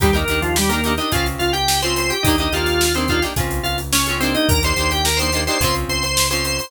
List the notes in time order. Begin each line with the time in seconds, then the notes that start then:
0.00 D#2 G3 D4 D#4 G4 A#4, kick, closed hi-hat
0.13 A#3 D4 D#4 G4 A#4, closed hi-hat
0.28 D#2 D4 D#4 G4 A#4, closed hi-hat
0.42 F3 F4, closed hi-hat
0.56 G3 G4, snare
0.69 A#3 D4 D#4 G4 A#4, closed hi-hat
0.84 D4 D#4 G4 A#4, closed hi-hat
0.98 D4 D#4 G4 A#4 D#5, closed hi-hat
1.12 C#2 C4 C#4 F4 G#4 F5, kick, closed hi-hat
1.26 closed hi-hat
1.39 C#2 F4 F5, snare, closed hi-hat
1.53 G4 G5, closed hi-hat
1.68 snare
1.82 C4 C#4 F4 G#4 C5 C6, closed hi-hat
1.96 C5 C6, closed hi-hat
2.10 G4 G5, closed hi-hat
2.23 D#2 D4 D#4 G4 D#5, kick, closed hi-hat
2.28 A#3
2.38 A#3 D4 D#4 G4 D#5, closed hi-hat
2.52 D#2 A#3 D4 D#4 F4 G4 F5, closed hi-hat
2.66 snare, closed hi-hat
2.81 snare
2.95 A#3 C4 D4 D#4 G4 C5, closed hi-hat
3.08 A#3 D4 D#4 F4 G4 F5, kick, closed hi-hat
3.22 A#3 D4 D#4 G4, snare, closed hi-hat
3.36 C#2 C4 C#4 F4 G#4, kick, closed hi-hat
3.51 closed hi-hat
3.63 C#2 F4 F5, closed hi-hat
3.78 closed hi-hat
3.93 C#4 C#5, snare
4.06 C#4 F4 G#4, closed hi-hat
4.10 C4
4.20 A#3 C4 D4 D#4 G4 C5, closed hi-hat
4.34 D#4 D#5, closed hi-hat
4.49 D#2 A#4 A#5, kick, closed hi-hat
4.63 A#3 D4 D#4 G4 C5 C6, closed hi-hat
4.76 D#2 A#3 D4 D#4 G4, snare, closed hi-hat
4.91 G4 G5, snare, closed hi-hat
5.05 A#4 A#5, snare
5.17 D4 D#4 G4 C5 C6, closed hi-hat
5.22 A#3
5.32 D4 D#4 G4, snare, closed hi-hat
5.36 A#3
5.47 A#3 D4 D#4 G4 C5 C6, closed hi-hat
5.60 C#2 C4 C#4 F4 G#4 C5 C6, kick, closed hi-hat
5.75 closed hi-hat
5.89 C#2 C5 C6, closed hi-hat
6.03 C5 C6, snare, closed hi-hat
6.17 snare
6.30 C4 C#4 F4 G#4 C5 C6, closed hi-hat
6.45 C5 C6, snare, closed hi-hat
6.58 C5 C6, open hi-hat